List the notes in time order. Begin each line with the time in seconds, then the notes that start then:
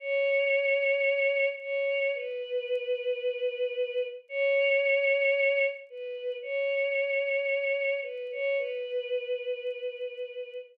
0.00 C#5
1.60 C#5
2.15 B4
4.29 C#5
5.90 B4
6.42 C#5
8.02 B4
8.31 C#5
8.58 B4